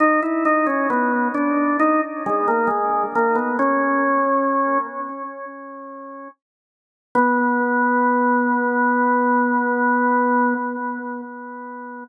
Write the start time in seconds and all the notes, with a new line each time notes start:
0.00 D#4
0.22 E4
0.45 D#4
0.66 C#4
0.90 B3
1.34 D4
1.79 D#4
2.26 G#3
2.47 A#3
2.67 G#3
3.15 A#3
3.35 B3
3.59 C#4
7.15 B3